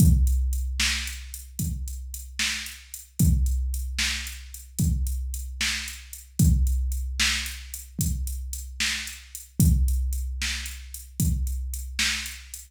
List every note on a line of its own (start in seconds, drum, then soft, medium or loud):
0.00 kick loud
0.00 closed hi-hat medium
0.27 closed hi-hat medium
0.53 closed hi-hat medium
0.80 snare loud
1.07 closed hi-hat medium
1.34 closed hi-hat medium
1.59 kick medium
1.59 closed hi-hat medium
1.88 closed hi-hat medium
2.14 closed hi-hat medium
2.39 snare medium
2.66 closed hi-hat medium
2.94 closed hi-hat medium
3.19 kick medium
3.19 closed hi-hat medium
3.46 closed hi-hat medium
3.74 closed hi-hat medium
3.99 snare medium
4.27 closed hi-hat medium
4.54 closed hi-hat medium
4.79 kick medium
4.79 closed hi-hat medium
5.07 closed hi-hat medium
5.34 closed hi-hat medium
5.61 snare medium
5.88 closed hi-hat medium
6.13 closed hi-hat medium
6.39 kick medium
6.39 closed hi-hat loud
6.67 closed hi-hat medium
6.92 closed hi-hat medium
7.20 snare loud
7.46 closed hi-hat medium
7.74 closed hi-hat medium
7.99 kick medium
7.99 closed hi-hat loud
8.27 closed hi-hat medium
8.53 closed hi-hat medium
8.80 snare medium
9.07 closed hi-hat medium
9.35 closed hi-hat medium
9.60 kick medium
9.60 closed hi-hat loud
9.88 closed hi-hat medium
10.13 closed hi-hat medium
10.42 snare medium
10.66 closed hi-hat medium
10.94 closed hi-hat medium
11.20 kick medium
11.20 closed hi-hat medium
11.47 closed hi-hat medium
11.74 closed hi-hat medium
11.99 snare loud
12.26 closed hi-hat medium
12.54 closed hi-hat medium